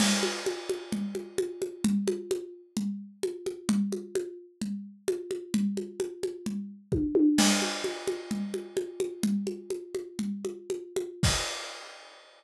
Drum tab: CC |x-------|--------|--------|--------|
T1 |--------|--------|--------|------oo|
CG |OoooOooo|Ooo-O-oo|Ooo-O-oo|OoooO---|
BD |--------|--------|--------|------o-|

CC |x-------|--------|x-------|
T1 |--------|--------|--------|
CG |OoooOooo|OoooOooo|--------|
BD |--------|--------|o-------|